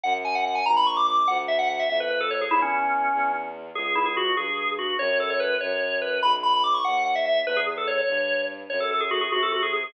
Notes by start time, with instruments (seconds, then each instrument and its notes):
0.04 violin F#2, drawbar organ F#5
0.25 drawbar organ G#5
0.35 drawbar organ F#5
0.45 drawbar organ F#5
0.55 drawbar organ G#5
0.66 violin A#1, drawbar organ A#5
0.77 drawbar organ B5
0.87 drawbar organ C#6
0.97 drawbar organ D6
1.07 drawbar organ D6
1.18 drawbar organ D6
1.28 violin D2, drawbar organ F#5
1.48 drawbar organ E5
1.59 drawbar organ F#5
1.70 drawbar organ F#5
1.79 drawbar organ E5
1.89 violin F2, drawbar organ E5
2.00 drawbar organ B4
2.10 drawbar organ B4
2.21 drawbar organ A4
2.31 drawbar organ C#5
2.41 drawbar organ G#4
2.51 violin E2, drawbar organ E4
2.62 drawbar organ C#4
3.13 violin E2
3.75 violin C#2, drawbar organ G#4
3.95 drawbar organ E4
4.06 drawbar organ G#4
4.17 drawbar organ F#4
4.37 violin G2, drawbar organ G#4
4.79 drawbar organ F#4
4.99 violin F#2, drawbar organ C#5
5.20 drawbar organ A4
5.30 drawbar organ C#5
5.40 drawbar organ B4
5.61 violin F#2, drawbar organ C#5
6.02 drawbar organ B4
6.22 violin B1, drawbar organ B5
6.43 drawbar organ B5
6.53 drawbar organ B5
6.64 drawbar organ D6
6.74 drawbar organ C#6
6.84 violin D#2, drawbar organ F#5
7.05 drawbar organ F#5
7.15 drawbar organ E5
7.26 drawbar organ E5
7.45 violin E2, drawbar organ B4
7.57 drawbar organ G#4
7.77 drawbar organ A4
7.87 drawbar organ C#5
7.98 drawbar organ C#5
8.08 violin G2
8.70 violin F#2, drawbar organ C#5
8.80 drawbar organ A4
8.91 drawbar organ A4
9.01 drawbar organ G#4
9.11 drawbar organ F#4
9.21 drawbar organ G#4
9.31 violin C3, drawbar organ F#4
9.43 drawbar organ A4
9.52 drawbar organ F#4
9.62 drawbar organ G#4
9.73 drawbar organ G#4
9.84 drawbar organ G#4